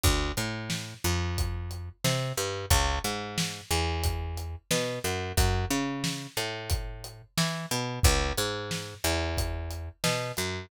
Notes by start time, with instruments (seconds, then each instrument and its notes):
0.03 electric bass (finger) D2, kick, closed hi-hat
0.37 electric bass (finger) A2, closed hi-hat
0.70 snare
1.04 electric bass (finger) F2, closed hi-hat
1.38 kick, closed hi-hat
1.71 closed hi-hat
2.04 electric bass (finger) C3, snare
2.38 electric bass (finger) G2, closed hi-hat
2.70 electric bass (finger) C#2, kick, closed hi-hat
3.04 electric bass (finger) G#2, closed hi-hat
3.38 snare
3.71 electric bass (finger) E2, closed hi-hat
4.04 kick, closed hi-hat
4.38 closed hi-hat
4.71 electric bass (finger) B2, snare
5.04 electric bass (finger) F#2, closed hi-hat
5.37 electric bass (finger) F#2, kick, closed hi-hat
5.70 electric bass (finger) C#3, closed hi-hat
6.04 snare
6.37 electric bass (finger) A2, closed hi-hat
6.70 kick, closed hi-hat
7.04 closed hi-hat
7.38 electric bass (finger) E3, snare
7.71 electric bass (finger) B2, closed hi-hat
8.03 electric bass (finger) C#2, kick, closed hi-hat
8.38 electric bass (finger) G#2, closed hi-hat
8.71 snare
9.04 electric bass (finger) E2, closed hi-hat
9.38 kick, closed hi-hat
9.71 closed hi-hat
10.04 electric bass (finger) B2, snare
10.37 electric bass (finger) F#2, closed hi-hat